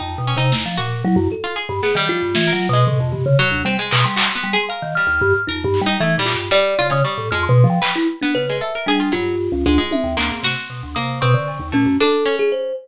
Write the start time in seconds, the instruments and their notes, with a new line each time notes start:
0.00 vibraphone F2, harpsichord D#4, kalimba G5
0.18 vibraphone B2
0.27 harpsichord C#4
0.37 vibraphone C3, harpsichord D#4
0.52 vibraphone E2, snare
0.66 vibraphone F3
0.77 vibraphone A#2, harpsichord F#4
1.04 vibraphone F#3, kalimba E4
1.16 vibraphone F#2
1.32 kalimba A4
1.44 harpsichord F4
1.56 harpsichord G#4
1.69 vibraphone G2
1.83 harpsichord B3, kalimba G#4, snare
1.95 vibraphone D#3, harpsichord G3, kalimba G5
2.07 vibraphone F3, kalimba F4
2.22 vibraphone G2
2.35 vibraphone E3, snare
2.47 harpsichord A#4
2.53 vibraphone F#3
2.69 vibraphone B2
2.73 harpsichord G#3, kalimba D#5
2.87 vibraphone A2, floor tom
3.00 vibraphone F2
3.12 vibraphone G2, floor tom
3.26 vibraphone C#3
3.39 harpsichord F#3
3.51 vibraphone D2
3.65 vibraphone G3, harpsichord C4
3.79 harpsichord G#3
3.91 vibraphone B2, clap
4.04 vibraphone G3, kalimba C6
4.16 harpsichord F#4, clap
4.35 harpsichord B3
4.44 vibraphone G3
4.53 harpsichord G#4
4.69 harpsichord A#4, kalimba F5
4.82 vibraphone D#3
4.95 harpsichord G3, kalimba F6
5.07 vibraphone D#2
5.21 vibraphone G2
5.47 vibraphone F2, kalimba D#4, harpsichord A#4
5.64 vibraphone G2
5.74 clap
5.81 vibraphone G3
5.86 harpsichord D#4
6.00 vibraphone E3, harpsichord A3
6.18 vibraphone A#2, harpsichord G3
6.26 kalimba F4, clap
6.34 vibraphone G2, harpsichord G4
6.51 harpsichord G3, kalimba D5
6.79 vibraphone C#3, harpsichord F4
6.90 vibraphone C#3, harpsichord C#4, kalimba D#6
7.04 harpsichord G3, kalimba C#6
7.18 vibraphone A2
7.31 vibraphone F2, harpsichord G#3, kalimba F6
7.43 kalimba C6
7.49 vibraphone B2
7.64 vibraphone F3
7.70 kalimba G5
7.82 harpsichord B4, clap
7.96 kalimba E4
8.22 harpsichord B3, kalimba D4
8.35 vibraphone C#3, kalimba B4
8.49 harpsichord G#3
8.61 harpsichord A4, kalimba E5
8.75 harpsichord A#4
8.86 vibraphone G3, kalimba D4, harpsichord G#4
9.00 harpsichord F4
9.12 vibraphone G2, harpsichord F#3, kalimba F4
9.52 vibraphone C#2
9.66 vibraphone D2, harpsichord G#3
9.78 harpsichord G#3
9.91 kalimba E5, high tom
10.04 vibraphone D#2
10.17 vibraphone D2, harpsichord A#3, kalimba C6, clap
10.31 vibraphone G#2
10.43 vibraphone C3, harpsichord F#4, snare
10.70 vibraphone B2
10.83 vibraphone D2
10.95 vibraphone C3, harpsichord A#3, kalimba D#6
11.21 vibraphone B2, harpsichord C4, kalimba C#6
11.34 vibraphone D3
11.48 cowbell
11.60 vibraphone D#2
11.72 vibraphone A#2, harpsichord A3, kalimba C#4
11.86 vibraphone F#2
12.00 harpsichord D4, kalimba A4
12.26 harpsichord C#4
12.39 kalimba G#4
12.52 kalimba C5